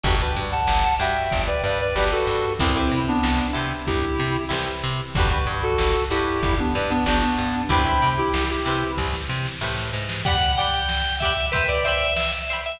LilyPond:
<<
  \new Staff \with { instrumentName = "Clarinet" } { \time 4/4 \key g \mixolydian \tempo 4 = 94 r8. <fis'' a''>8. <e'' g''>8. <b' d''>16 <b' d''>16 <b' d''>16 <g' b'>16 <fis' a'>8. | <c' e'>8. <b d'>8. r8 <e' g'>4 r4 | r8. <fis' a'>8. <e' g'>8. <b d'>16 <b' d''>16 <b d'>16 <b d'>16 <b d'>8. | <g'' b''>8. <e' g'>8 <e' g'>8. r2 |
r1 | }
  \new Staff \with { instrumentName = "Drawbar Organ" } { \time 4/4 \key g \mixolydian r1 | r1 | r1 | r1 |
fis''8 g''4 e''8 b'16 d''16 e''8 e''16 r8 e''16 | }
  \new Staff \with { instrumentName = "Pizzicato Strings" } { \time 4/4 \key g \mixolydian <d' fis' g' b'>16 <d' fis' g' b'>4~ <d' fis' g' b'>16 <d' fis' g' b'>4. <d' fis' g' b'>4 | <e' g' b' c''>16 <e' g' b' c''>4~ <e' g' b' c''>16 <e' g' b' c''>4. <e' g' b' c''>4 | <d' fis' g' b'>16 <d' fis' g' b'>4~ <d' fis' g' b'>16 <d' fis' g' b'>4. <d' fis' g' b'>4 | <e' g' b' c''>16 <e' g' b' c''>4~ <e' g' b' c''>16 <e' g' b' c''>4. <e' g' b' c''>4 |
<g' d'' fis'' b''>8 <g' d'' fis'' b''>4 <g' d'' fis'' b''>8 <c'' e'' g'' b''>8 <c'' e'' g'' b''>4 <c'' e'' g'' b''>8 | }
  \new Staff \with { instrumentName = "Electric Bass (finger)" } { \clef bass \time 4/4 \key g \mixolydian g,,8 g,8 g,,8 g,8 g,,8 g,8 g,,8 g,8 | c,8 c8 c,8 c8 c,8 c8 c,8 c8 | g,,8 g,8 g,,8 g,8 g,,8 g,8 g,,8 g,8 | c,8 c8 c,8 c8 c,8 c8 a,8 gis,8 |
r1 | }
  \new DrumStaff \with { instrumentName = "Drums" } \drummode { \time 4/4 <cymc bd>16 hh16 hh16 hh16 sn16 hh16 hh16 hh16 <hh bd>16 hh16 <hh sn>16 hh16 sn16 hh16 hh16 hh16 | <hh bd>16 <hh sn>16 hh16 hh16 sn16 hh16 hh16 <hh sn>16 <hh bd>16 hh16 <hh sn>16 hh16 sn16 hh16 hh16 hh16 | <hh bd>16 hh16 <hh sn>16 hh16 sn16 hh16 hh16 <hh sn>16 <hh bd>16 hh16 <hh sn>16 hh16 sn16 hh16 hh16 hh16 | <hh bd>16 hh16 <hh sn>16 hh16 sn16 hh16 hh16 <hh sn>16 <bd sn>16 sn16 sn16 sn16 sn16 sn8 sn16 |
<cymc bd>16 cymr16 cymr16 cymr16 sn16 cymr16 <bd cymr>16 cymr16 <bd cymr>16 cymr16 cymr16 cymr16 sn16 cymr16 cymr16 cymr16 | }
>>